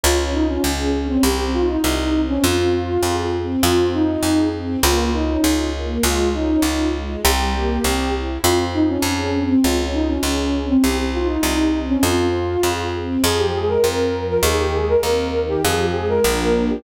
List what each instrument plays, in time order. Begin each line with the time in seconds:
0.04 electric bass (finger) C#2, string ensemble 1 C#4, flute F4
0.34 flute D#4, string ensemble 1 F4
0.48 flute C#4
0.64 electric bass (finger) C#2, string ensemble 1 G#4
0.94 string ensemble 1 C#4
1.08 flute C4
1.23 electric bass (finger) C2, string ensemble 1 C4, flute G4
1.54 string ensemble 1 D#4, flute F4
1.69 flute D#4
1.84 electric bass (finger) C2, string ensemble 1 G4
2.14 string ensemble 1 C4
2.29 flute C#4
2.43 electric bass (finger) F2, string ensemble 1 C4, flute F4
2.73 string ensemble 1 F4
3.03 electric bass (finger) F2, string ensemble 1 G#4
3.34 string ensemble 1 C4
3.63 electric bass (finger) F2, string ensemble 1 C4, flute F4
3.93 flute D#4, string ensemble 1 F4
4.23 electric bass (finger) F2, string ensemble 1 G#4
4.54 string ensemble 1 C4
4.83 electric bass (finger) C#2, string ensemble 1 A#3, flute F4
5.13 string ensemble 1 C#4, flute D#4
5.44 electric bass (finger) C#2, string ensemble 1 F4
5.74 string ensemble 1 A#3
6.03 electric bass (finger) C#2, string ensemble 1 G#3, flute F4
6.34 string ensemble 1 C#4, flute D#4
6.62 electric bass (finger) C#2, string ensemble 1 F4
6.93 string ensemble 1 G#3
7.24 electric bass (finger) C2, string ensemble 1 G3, flute G4
7.53 string ensemble 1 A#3
7.83 electric bass (finger) C2, string ensemble 1 C4
8.13 string ensemble 1 E4
8.44 electric bass (finger) F2, string ensemble 1 C4, flute F4
8.73 flute D#4, string ensemble 1 F4
8.89 flute C#4
9.02 electric bass (finger) F2, string ensemble 1 G#4
9.34 string ensemble 1 C4
9.49 flute C4
9.63 electric bass (finger) C#2, string ensemble 1 C#4, flute F4
9.93 flute D#4, string ensemble 1 F4
10.09 flute C#4
10.23 electric bass (finger) C#2, string ensemble 1 G#4
10.54 string ensemble 1 C#4
10.69 flute C4
10.84 electric bass (finger) C2, string ensemble 1 C4, flute G4
11.13 string ensemble 1 D#4, flute F4
11.29 flute D#4
11.43 electric bass (finger) C2, string ensemble 1 G4
11.73 string ensemble 1 C4
11.88 flute C#4
12.03 electric bass (finger) F2, string ensemble 1 C4, flute F4
12.34 string ensemble 1 F4
12.63 electric bass (finger) F2, string ensemble 1 G#4
12.94 string ensemble 1 C4
13.23 electric bass (finger) F2, string ensemble 1 F3, flute G#4
13.38 flute G4
13.54 string ensemble 1 G#3, flute G#4
13.69 flute A#4
13.84 electric bass (finger) F2, string ensemble 1 C4
14.13 string ensemble 1 F3
14.29 flute A#4
14.43 electric bass (finger) D#2, string ensemble 1 D#3, flute G#4
14.59 flute G4
14.73 string ensemble 1 G#3, flute G#4
14.88 flute A#4
15.03 electric bass (finger) D#2, string ensemble 1 C4
15.34 string ensemble 1 D#3
15.49 flute G4
15.63 electric bass (finger) F2, string ensemble 1 F3, flute G#4
15.79 flute G4
15.94 string ensemble 1 G#3, flute G#4
16.09 flute A#4
16.24 electric bass (finger) A#1, string ensemble 1 F3 A#3 D4
16.68 flute G4